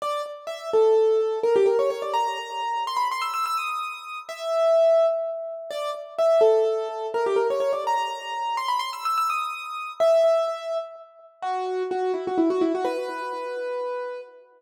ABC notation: X:1
M:6/8
L:1/16
Q:3/8=84
K:Bm
V:1 name="Acoustic Grand Piano"
d2 z2 e2 A6 | ^A G A c c d ^a6 | =c' b c' e' e' e' ^d'6 | e8 z4 |
d2 z2 e2 A6 | ^A G A c c d ^a6 | =c' b c' e' e' e' ^d'6 | e8 z4 |
F4 F2 E F E F E F | B12 |]